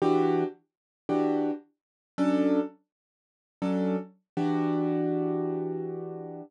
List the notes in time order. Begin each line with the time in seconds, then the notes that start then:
0.02 E3 D4 F#4 G4
1.09 E3 D4 F#4 G4
2.18 F#3 C#4 D4 A4
3.62 F#3 C#4 D4 A4
4.37 E3 D4 F#4 G4